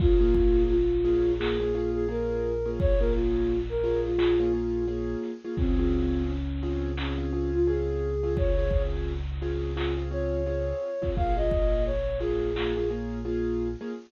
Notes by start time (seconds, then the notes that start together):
0.00 A#1 A#3 C#4 F4 G#4, kick, crash
0.20 A#3 C#4 F4 G#4, closed hi-hat
0.35 kick, closed hi-hat
0.55 closed hi-hat
0.69 F4, closed hi-hat
0.92 closed hi-hat
1.04 A#3 C#4 F4 G#4, closed hi-hat
1.25 closed hi-hat
1.39 A#3 C#4 F4 G#4, clap
1.60 A#3 C#4 F4 G#4, closed hi-hat
1.74 A#3 C#4 F4 G#4, closed hi-hat
1.94 G#4
2.08 A#3 C#4 F4 G#4 A#4, closed hi-hat
2.65 A#3 C#4 F4 G#4
2.80 C#5, kick, closed hi-hat
2.99 A#3 C#4 F4 G#4 A#4, closed hi-hat
3.13 F4, closed hi-hat
3.34 closed hi-hat
3.49 closed hi-hat
3.69 A#4, closed hi-hat
3.84 A#3 C#4 F4 G#4, closed hi-hat
4.04 F4, closed hi-hat
4.18 A#3 C#4 F4 G#4, clap
4.40 A#3 C#4 F4 G#4, closed hi-hat
4.53 A#3 C#4 F4 G#4
4.87 A#3 C#4 F4 G#4, closed hi-hat
5.23 snare, closed hi-hat
5.44 A#3 C#4 F4 G#4
5.57 C#2 C4 C#4 F4 G#4, kick, closed hi-hat
5.79 C4 C#4 F4 G#4, closed hi-hat
5.92 closed hi-hat
6.14 closed hi-hat
6.27 C#4, closed hi-hat
6.49 closed hi-hat
6.63 C4 C#4 F4 G#4, closed hi-hat
6.83 closed hi-hat
6.97 C4 C#4 F4 G#4, clap
7.18 C4 C#4 F4 G#4, closed hi-hat
7.33 C4 C#4 F4 G#4
7.53 F4, closed hi-hat
7.67 C4 C#4 F4 G#4, closed hi-hat
7.88 closed hi-hat
8.23 C4 C#4 F4 G#4
8.37 C#5, kick, closed hi-hat
8.58 C4 C#4 F4 G#4, closed hi-hat
8.71 kick, closed hi-hat
8.93 closed hi-hat
9.08 closed hi-hat
9.26 closed hi-hat
9.41 C4 C#4 F4 G#4, closed hi-hat
9.62 closed hi-hat
9.77 C4 C#4 F4 G#4, clap
9.97 C4 C#4 F4 G#4, closed hi-hat
10.11 C4 C#4 F4 G#4 C#5, closed hi-hat
10.32 closed hi-hat
10.46 C4 C#4 F4 G#4, closed hi-hat
11.01 C4 C#4 F4 G#4, kick, closed hi-hat
11.16 A#1 A#3 C#4 F4 G#4 F5, kick, closed hi-hat
11.36 A#3 C#4 F4 G#4 D#5, closed hi-hat
11.51 kick, closed hi-hat
11.72 closed hi-hat
11.85 C#5, closed hi-hat
12.07 closed hi-hat
12.20 A#3 C#4 F4 G#4, closed hi-hat
12.41 closed hi-hat
12.56 A#3 C#4 F4 G#4, clap
12.76 A#3 C#4 F4 G#4, closed hi-hat
12.90 A#3 C#4 F4 G#4, closed hi-hat
13.25 A#3 C#4 F4 G#4, closed hi-hat
13.81 A#3 C#4 F4 G#4